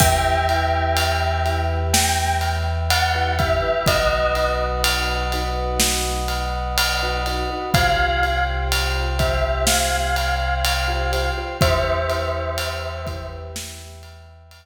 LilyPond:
<<
  \new Staff \with { instrumentName = "Tubular Bells" } { \time 4/4 \key e \minor \tempo 4 = 62 <e'' g''>2 g''8 r8 fis''8 e''8 | dis''8. r2. r16 | f''8. r8. e''8 f''2 | <c'' e''>2 r2 | }
  \new Staff \with { instrumentName = "Vibraphone" } { \time 4/4 \key e \minor <e' g' b'>8 <e' g' b'>4 <e' g' b'>4.~ <e' g' b'>16 <e' g' b'>16 <e' g' b'>16 <e' g' b'>16 | <dis' fis' b'>8 <dis' fis' b'>4 <dis' fis' b'>4.~ <dis' fis' b'>16 <dis' fis' b'>16 <dis' fis' b'>16 <dis' fis' b'>16 | <f' g' c''>8 <f' g' c''>4 <f' g' c''>4.~ <f' g' c''>16 <f' g' c''>16 <f' g' c''>16 <f' g' c''>16 | <e' g' b'>8 <e' g' b'>4 <e' g' b'>4.~ <e' g' b'>16 r8. | }
  \new Staff \with { instrumentName = "Synth Bass 2" } { \clef bass \time 4/4 \key e \minor e,1 | b,,1 | c,1 | e,1 | }
  \new Staff \with { instrumentName = "Brass Section" } { \time 4/4 \key e \minor <b' e'' g''>1 | <b' dis'' fis''>1 | <c'' f'' g''>1 | <b' e'' g''>1 | }
  \new DrumStaff \with { instrumentName = "Drums" } \drummode { \time 4/4 <cymc bd>8 cymr8 cymr8 cymr8 sn8 cymr8 cymr8 <bd cymr>8 | <bd cymr>8 cymr8 cymr8 cymr8 sn8 cymr8 cymr8 cymr8 | <bd cymr>8 cymr8 cymr8 <bd cymr>8 sn8 cymr8 cymr8 cymr8 | <bd cymr>8 cymr8 cymr8 <bd cymr>8 sn8 cymr8 cymr4 | }
>>